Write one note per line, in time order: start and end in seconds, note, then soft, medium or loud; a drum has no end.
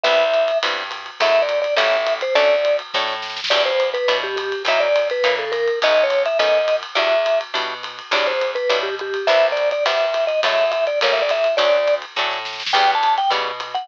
0.03 0.52 C2 medium
0.03 0.24 G3 loud
0.03 0.24 B3 loud
0.03 0.24 C4 loud
0.03 0.24 E4 loud
0.03 0.58 E5 loud
0.03 kick medium
0.03 ride medium
0.34 hi-hat pedal medium
0.34 ride medium
0.48 ride medium
0.63 1.10 G2 medium
0.63 0.83 G3 medium
0.63 0.83 B3 loud
0.63 0.83 C4 medium
0.63 0.83 E4 medium
0.63 kick medium
0.63 ride loud
0.91 hi-hat pedal medium
0.91 ride medium
1.06 ride medium
1.20 1.66 F#2 medium
1.20 1.41 F#3 loud
1.20 1.41 G#3 loud
1.20 1.41 A3 loud
1.20 1.41 E4 loud
1.20 1.42 E5 loud
1.20 kick medium
1.20 ride loud
1.42 1.60 D5 medium
1.49 hi-hat pedal medium
1.49 ride medium
1.62 1.75 D5 medium
1.62 ride medium
1.76 2.24 A1 medium
1.76 1.97 G3 loud
1.76 1.97 A3 loud
1.76 1.97 A#3 loud
1.76 1.97 C#4 loud
1.76 2.14 E5 medium
1.76 kick soft
1.76 ride loud
2.06 hi-hat pedal medium
2.06 ride medium
2.21 2.34 C5 medium
2.21 ride medium
2.35 2.82 D2 medium
2.35 2.55 F#3 loud
2.35 2.55 A3 loud
2.35 2.55 C#4 loud
2.35 2.55 D4 loud
2.35 2.77 D5 loud
2.35 kick medium
2.35 ride medium
2.65 hi-hat pedal medium
2.65 ride medium
2.79 ride medium
2.94 3.40 A2 medium
2.94 3.15 F#3 medium
2.94 3.15 A3 medium
2.94 3.15 C#4 medium
2.94 3.15 D4 medium
2.94 kick medium
2.94 snare medium
3.07 snare medium
3.22 snare medium
3.30 snare medium
3.36 snare medium
3.44 snare loud
3.50 3.97 E2 medium
3.50 3.71 F#3 loud
3.50 3.71 G3 loud
3.50 3.71 D4 loud
3.50 3.71 E4 loud
3.50 3.63 D5 loud
3.50 kick medium
3.50 ride loud
3.66 3.89 C5 medium
3.80 hi-hat pedal medium
3.80 ride medium
3.94 4.17 B4 medium
3.94 ride medium
4.08 4.54 B2 medium
4.08 4.28 F#3 medium
4.08 4.28 G3 medium
4.08 4.28 D4 medium
4.08 4.28 E4 medium
4.08 kick medium
4.08 ride loud
4.23 4.36 G4 medium
4.36 4.63 G4 medium
4.36 hi-hat pedal medium
4.36 ride medium
4.52 ride medium
4.65 5.11 F#2 medium
4.65 4.88 F#3 medium
4.65 4.88 A#3 loud
4.65 4.88 D#4 loud
4.65 4.88 E4 loud
4.65 4.80 E5 loud
4.65 kick medium
4.65 ride loud
4.80 5.08 D5 loud
4.96 hi-hat pedal medium
4.96 ride medium
5.10 5.35 B4 medium
5.10 ride medium
5.23 5.70 C#3 medium
5.23 5.45 F#3 medium
5.23 5.45 A#3 medium
5.23 5.45 D#4 loud
5.23 5.45 E4 medium
5.23 kick medium
5.23 ride loud
5.39 5.51 A4 medium
5.52 5.79 A#4 medium
5.52 hi-hat pedal medium
5.52 ride medium
5.68 ride medium
5.82 6.28 B1 medium
5.82 6.04 A3 loud
5.82 6.04 B3 loud
5.82 6.04 C#4 loud
5.82 6.04 D#4 loud
5.82 6.04 D#5 loud
5.82 kick medium
5.82 ride loud
6.03 6.23 C#5 medium
6.10 hi-hat pedal medium
6.10 ride medium
6.26 6.38 E5 medium
6.26 ride medium
6.39 6.85 F#2 medium
6.39 6.59 A3 medium
6.39 6.59 B3 loud
6.39 6.59 C#4 medium
6.39 6.59 D#4 medium
6.39 6.76 D#5 loud
6.39 kick medium
6.39 ride loud
6.68 hi-hat pedal medium
6.68 ride medium
6.83 ride medium
6.95 7.43 E2 medium
6.95 7.16 F#3 loud
6.95 7.16 G3 loud
6.95 7.16 D4 loud
6.95 7.16 E4 loud
6.95 7.39 E5 medium
6.95 ride medium
7.26 hi-hat pedal medium
7.26 ride medium
7.41 ride medium
7.54 8.01 B2 medium
7.54 7.74 F#3 medium
7.54 7.74 G3 medium
7.54 7.74 D4 medium
7.54 7.74 E4 medium
7.54 kick medium
7.54 ride loud
7.83 hi-hat pedal medium
7.83 ride medium
7.99 ride medium
8.11 8.57 E2 medium
8.11 8.33 F#3 loud
8.11 8.33 G3 loud
8.11 8.33 D4 loud
8.11 8.33 E4 loud
8.11 8.26 D5 medium
8.11 kick medium
8.11 ride loud
8.27 8.51 C5 medium
8.41 hi-hat pedal medium
8.41 ride medium
8.55 8.79 B4 medium
8.55 ride medium
8.69 9.16 B2 medium
8.69 8.90 F#3 loud
8.69 8.90 G3 loud
8.69 8.90 D4 medium
8.69 8.90 E4 medium
8.69 kick medium
8.69 ride loud
8.83 8.95 G4 medium
8.99 9.27 G4 medium
8.99 hi-hat pedal medium
9.14 ride medium
9.27 9.73 C2 medium
9.27 9.49 G3 loud
9.27 9.49 B3 loud
9.27 9.49 C4 loud
9.27 9.49 E4 loud
9.27 9.47 E5 loud
9.27 kick medium
9.27 ride medium
9.52 9.69 D5 medium
9.57 hi-hat pedal medium
9.57 ride medium
9.71 9.84 D5 medium
9.71 ride medium
9.85 10.32 G2 medium
9.85 10.06 G3 medium
9.85 10.06 B3 loud
9.85 10.06 C4 medium
9.85 10.06 E4 medium
9.85 10.25 E5 medium
9.85 kick medium
9.85 ride loud
10.14 hi-hat pedal medium
10.14 ride medium
10.27 10.40 D#5 medium
10.27 ride medium
10.43 10.89 F#2 medium
10.43 10.64 F#3 loud
10.43 10.64 G#3 loud
10.43 10.64 A3 loud
10.43 10.64 E4 loud
10.43 10.71 E5 loud
10.43 kick medium
10.43 ride loud
10.72 10.85 E5 medium
10.72 hi-hat pedal medium
10.72 ride medium
10.87 10.99 D5 medium
10.87 ride medium
11.01 11.48 A1 medium
11.01 11.22 G3 loud
11.01 11.22 A3 loud
11.01 11.22 A#3 loud
11.01 11.22 C#4 loud
11.01 11.13 C#5 medium
11.01 kick soft
11.01 ride loud
11.13 11.22 E5 medium
11.22 11.31 D5 medium
11.29 11.55 E5 medium
11.29 hi-hat pedal medium
11.29 ride medium
11.44 ride medium
11.57 12.05 D2 medium
11.57 11.78 F#3 loud
11.57 11.78 A3 loud
11.57 11.78 C#4 loud
11.57 11.78 D4 loud
11.57 11.95 D5 loud
11.57 kick medium
11.57 ride medium
11.88 hi-hat pedal medium
11.88 ride medium
12.02 ride medium
12.16 12.63 A2 medium
12.16 12.39 F#3 medium
12.16 12.39 A3 medium
12.16 12.39 C#4 medium
12.16 12.39 D4 medium
12.16 kick medium
12.16 snare medium
12.31 snare medium
12.45 snare medium
12.53 snare medium
12.60 snare medium
12.66 snare loud
12.73 13.20 E2 medium
12.73 12.95 C#3 loud
12.73 12.95 E3 loud
12.73 12.95 G3 loud
12.73 12.95 B3 loud
12.73 12.91 G5 medium
12.73 kick medium
12.73 ride loud
12.95 13.15 A5 medium
13.03 hi-hat pedal medium
13.03 ride medium
13.18 13.30 G5 medium
13.18 ride medium
13.30 13.76 B2 medium
13.30 13.51 C#3 loud
13.30 13.51 E3 medium
13.30 13.51 G3 loud
13.30 13.51 B3 medium
13.30 kick medium
13.30 ride medium
13.60 hi-hat pedal medium
13.60 ride medium
13.74 13.88 F#5 medium
13.74 ride medium